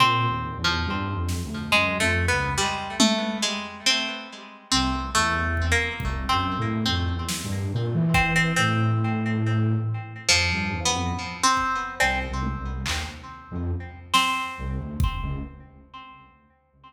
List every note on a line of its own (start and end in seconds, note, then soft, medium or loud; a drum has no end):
0.00 0.26 A#2 loud
0.00 0.58 C4 loud
0.29 0.54 D#2 medium
0.58 0.84 E2 medium
0.64 1.22 F3 medium
0.86 1.11 G2 loud
1.14 1.40 F2 medium
1.29 snare medium
1.44 1.70 D2 medium
1.72 1.98 F#2 medium
1.72 1.98 G#3 medium
1.99 2.25 F2 loud
1.99 2.26 A3 loud
2.28 2.55 C#2 soft
2.28 2.54 B3 medium
2.58 2.96 G3 medium
3.00 3.38 A3 loud
3.00 high tom loud
3.42 3.81 G#3 medium
3.86 4.63 C4 medium
4.71 5.10 C2 medium
4.71 5.10 C4 medium
5.15 5.73 E2 medium
5.15 5.66 A3 loud
5.57 kick medium
5.72 6.23 A#3 medium
6.00 6.26 C2 medium
6.00 kick medium
6.29 6.54 F#2 medium
6.29 6.81 C4 medium
6.58 6.84 A2 loud
6.86 7.12 F2 medium
6.86 8.01 C4 medium
7.14 7.40 E2 medium
7.29 snare medium
7.44 7.69 G2 loud
7.73 7.93 A#2 loud
7.94 8.52 E3 loud
8.14 8.34 C4 medium
8.14 kick loud
8.36 8.55 C4 medium
8.56 9.74 A2 loud
8.56 10.11 C4 loud
10.29 10.48 F2 medium
10.29 10.80 F3 loud
10.29 clap medium
10.51 10.71 G2 medium
10.73 10.93 E2 medium
10.85 11.37 B3 medium
10.93 11.12 F2 medium
11.43 11.95 C4 loud
11.57 kick medium
12.00 12.26 C2 medium
12.00 12.19 C4 medium
12.00 cowbell loud
12.29 12.55 C2 medium
12.43 high tom medium
12.58 12.84 C2 medium
12.86 13.05 D#2 medium
12.86 clap loud
13.51 13.71 F2 loud
14.14 15.29 C4 loud
14.14 snare medium
14.58 14.78 C2 medium
14.78 14.97 D2 medium
15.00 kick loud
15.22 15.41 C#2 medium